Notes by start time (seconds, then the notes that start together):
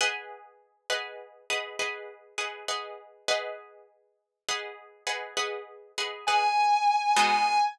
0.01 G#4 B4 D#5 F#5
0.90 G#4 B4 D#5 F#5
1.50 G#4 B4 D#5 F#5
1.79 G#4 B4 D#5 F#5
2.38 G#4 B4 D#5 F#5
2.68 G#4 B4 D#5 F#5
3.28 G#4 B4 D#5 F#5
4.49 G#4 B4 D#5 F#5
5.07 G#4 B4 D#5 F#5
5.37 G#4 B4 D#5 F#5
5.98 G#4 B4 D#5 F#5
6.27 G#4 B4 D#5 F#5 G#5
7.16 G#3 B3 D#4 F#4 G#5